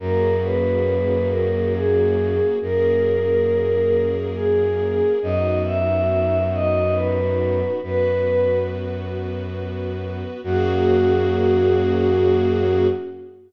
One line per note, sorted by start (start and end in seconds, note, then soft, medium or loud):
0.00 2.40 F#2 medium
0.00 2.58 A#3 medium
0.00 2.58 C#4 medium
0.00 2.58 F#4 medium
0.00 2.58 G#4 medium
0.00 0.36 A#4 medium
0.43 1.27 B4 medium
1.29 1.72 A#4 medium
1.74 2.47 G#4 medium
2.61 5.01 F#2 medium
2.61 5.19 A#3 medium
2.61 5.19 C#4 medium
2.61 5.19 G#4 medium
2.61 5.19 A#4 medium
2.61 4.08 A#4 medium
4.35 5.12 G#4 medium
5.21 7.62 F#2 medium
5.21 7.80 B3 medium
5.21 7.80 D#4 medium
5.21 7.80 F#4 medium
5.21 5.59 D#5 medium
5.65 6.44 E5 medium
6.53 6.96 D#5 medium
6.94 7.72 B4 medium
7.82 10.23 F#2 medium
7.82 10.41 B3 medium
7.82 10.41 F#4 medium
7.82 10.41 B4 medium
7.82 8.57 B4 medium
10.43 12.87 F#2 medium
10.43 12.87 A#3 loud
10.43 12.87 C#4 medium
10.43 12.87 F#4 loud
10.43 12.87 G#4 loud